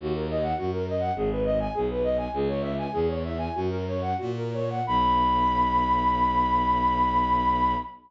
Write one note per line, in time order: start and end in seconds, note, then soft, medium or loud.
0.00 0.53 D#2 loud
0.00 0.15 F#4 medium
0.14 0.27 A#4 medium
0.30 0.43 D#5 medium
0.42 0.56 F#5 medium
0.58 1.11 F#2 medium
0.58 0.71 F#4 medium
0.73 0.86 A#4 medium
0.89 1.02 D#5 medium
1.00 1.13 F#5 medium
1.15 1.68 G#1 loud
1.15 1.29 G#4 medium
1.32 1.45 B4 medium
1.45 1.58 D#5 medium
1.60 1.73 G#5 medium
1.74 2.28 B1 medium
1.74 1.87 G#4 medium
1.90 2.04 B4 medium
2.04 2.17 D#5 medium
2.18 2.31 G#5 medium
2.33 2.87 C#2 loud
2.33 2.48 G#4 medium
2.48 2.62 C#5 medium
2.61 2.75 E5 medium
2.78 2.92 G#5 medium
2.92 3.49 E2 loud
2.92 3.07 G#4 medium
3.08 3.22 C#5 medium
3.25 3.39 E5 medium
3.38 3.53 G#5 medium
3.55 4.14 F#2 medium
3.55 3.70 F#4 medium
3.70 3.85 A#4 medium
3.88 4.03 C#5 medium
4.01 4.17 F#5 medium
4.17 4.81 A#2 medium
4.17 4.33 F#4 medium
4.37 4.53 A#4 medium
4.54 4.69 C#5 medium
4.70 4.86 F#5 medium
4.87 7.75 B1 loud
4.87 7.75 B5 loud